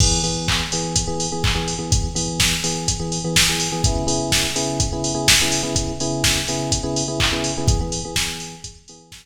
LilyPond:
<<
  \new Staff \with { instrumentName = "Electric Piano 1" } { \time 4/4 \key e \major \tempo 4 = 125 <e b gis'>8 <e b gis'>4 <e b gis'>8. <e b gis'>8 <e b gis'>8 <e b gis'>8 <e b gis'>16~ | <e b gis'>8 <e b gis'>4 <e b gis'>8. <e b gis'>8 <e b gis'>8 <e b gis'>8 <e b gis'>16 | <cis b e' gis'>8 <cis b e' gis'>4 <cis b e' gis'>8. <cis b e' gis'>8 <cis b e' gis'>8 <cis b e' gis'>8 <cis b e' gis'>16~ | <cis b e' gis'>8 <cis b e' gis'>4 <cis b e' gis'>8. <cis b e' gis'>8 <cis b e' gis'>8 <cis b e' gis'>8 <cis b e' gis'>16 |
<e b gis'>16 <e b gis'>8 <e b gis'>16 <e b gis'>4. <e b gis'>4 r8 | }
  \new DrumStaff \with { instrumentName = "Drums" } \drummode { \time 4/4 <cymc bd>8 hho8 <hc bd>8 hho8 <hh bd>8 hho8 <hc bd>8 hho8 | <hh bd>8 hho8 <bd sn>8 hho8 <hh bd>8 hho8 <bd sn>8 hho8 | <hh bd>8 hho8 <bd sn>8 hho8 <hh bd>8 hho8 <bd sn>8 hho8 | <hh bd>8 hho8 <bd sn>8 hho8 <hh bd>8 hho8 <hc bd>8 hho8 |
<hh bd>8 hho8 <bd sn>8 hho8 <hh bd>8 hho8 <bd sn>4 | }
>>